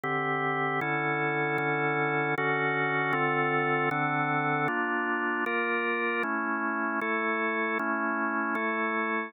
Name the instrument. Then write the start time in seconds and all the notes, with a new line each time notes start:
drawbar organ
0.04 D3 C4 G4
0.81 D3 C#4 E4 A4
1.58 D3 C#4 E4 A4
2.38 D3 C#4 F#4 A4
3.13 D3 C4 F4 A4
3.91 D3 C4 D4 A4
4.68 A#3 D4 F4
5.46 A#3 F4 A#4
6.23 A3 C#4 E4
7.01 A3 E4 A4
7.79 A3 C#4 E4
8.55 A3 E4 A4